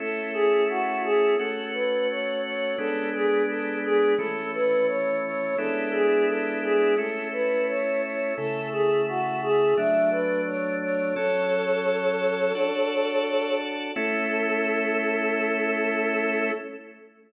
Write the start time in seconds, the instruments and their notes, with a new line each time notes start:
0.00 drawbar organ A3 C#4 E4, choir aahs A4
0.33 choir aahs G#4
0.69 choir aahs F#4
1.04 choir aahs G#4
1.39 drawbar organ A3 C#4 F#4, choir aahs A4
1.74 choir aahs B4
2.10 choir aahs C#5
2.45 choir aahs C#5
2.78 drawbar organ G#3 B3 D4, choir aahs A4
3.15 choir aahs G#4
3.49 choir aahs A4
3.85 choir aahs G#4
4.18 drawbar organ E3 A3 C#4, choir aahs A4
4.54 choir aahs B4
4.88 choir aahs C#5
5.25 choir aahs C#5
5.58 drawbar organ G#3 B3 D4 E4, choir aahs A4
5.92 choir aahs G#4
6.28 choir aahs A4
6.63 choir aahs G#4
6.98 drawbar organ A3 C#4 E4, choir aahs A4
7.33 choir aahs B4
7.68 choir aahs C#5
8.02 choir aahs C#5
8.37 drawbar organ C#3 A3 E4, choir aahs A4
8.72 choir aahs G#4
9.08 choir aahs F#4
9.43 choir aahs G#4
9.77 drawbar organ F#3 A3 D4, choir aahs E5
10.11 choir aahs B4
10.46 choir aahs C#5
10.82 choir aahs C#5
11.16 drawbar organ F#3 C#4 A4, choir aahs A4 C#5
12.55 drawbar organ D4 F#4 A4
13.96 drawbar organ A3 C#4 E4, choir aahs A4